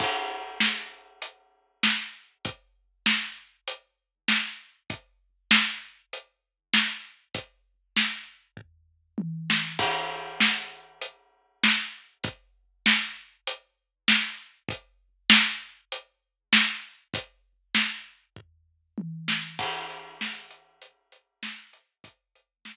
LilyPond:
\new DrumStaff \drummode { \time 4/4 \tempo 4 = 98 <cymc bd>4 sn4 hh4 sn4 | <hh bd>4 sn4 hh4 sn4 | <hh bd>4 sn4 hh4 sn4 | <hh bd>4 sn4 <bd tomfh>4 tommh8 sn8 |
<cymc bd>4 sn4 hh4 sn4 | <hh bd>4 sn4 hh4 sn4 | <hh bd>4 sn4 hh4 sn4 | <hh bd>4 sn4 <bd tomfh>4 tommh8 sn8 |
<cymc bd>8 hh8 sn8 hh8 hh8 hh8 sn8 hh8 | <hh bd>8 hh8 sn4 r4 r4 | }